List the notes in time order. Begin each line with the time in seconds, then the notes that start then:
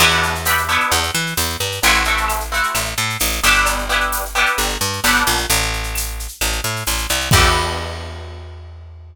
0.00 E2 B3 D4 E4 G4, crash, cowbell, claves
0.10 shaker
0.23 shaker
0.35 shaker
0.45 B3 D4 E4 G4, tambourine, shaker
0.58 shaker
0.69 B3 D4 E4 G4, claves, shaker
0.80 shaker
0.91 E2, cowbell, shaker
1.03 shaker
1.15 E3, shaker
1.26 shaker
1.37 E2, tambourine, cowbell, claves, shaker
1.49 shaker
1.60 G2, cowbell, shaker
1.72 shaker
1.83 A1 A3 C4 E4 F#4, cowbell, shaker
1.94 shaker
2.04 A3 C4 E4 F#4, shaker
2.17 shaker
2.28 tambourine, claves, shaker
2.40 shaker
2.52 A3 C4 E4 F#4, shaker
2.63 shaker
2.75 A1, cowbell, claves, shaker
2.85 shaker
2.98 A2, shaker
3.10 shaker
3.19 A1, tambourine, cowbell, shaker
3.32 shaker
3.43 G1 B3 D4 E4 G4, cowbell, shaker
3.55 shaker
3.66 cowbell, claves, shaker
3.79 shaker
3.89 B3 D4 E4 G4, shaker
4.00 shaker
4.12 tambourine, shaker
4.25 shaker
4.35 B3 D4 E4 G4, claves, shaker
4.46 shaker
4.58 G1, cowbell, shaker
4.69 shaker
4.81 G2, shaker
4.93 shaker
5.04 G1 B3 D4 E4 G4, tambourine, cowbell, claves, shaker
5.16 shaker
5.27 A#1, cowbell, shaker
5.37 shaker
5.50 A1, cowbell, shaker
5.62 shaker
5.73 shaker
5.83 shaker
5.95 tambourine, claves, shaker
6.07 shaker
6.19 shaker
6.28 shaker
6.41 A1, cowbell, claves, shaker
6.52 shaker
6.64 A2, shaker
6.76 shaker
6.87 A1, tambourine, cowbell, shaker
6.98 shaker
7.09 C2, cowbell, shaker
7.20 shaker
7.31 E2 B3 D4 E4 G4, kick, crash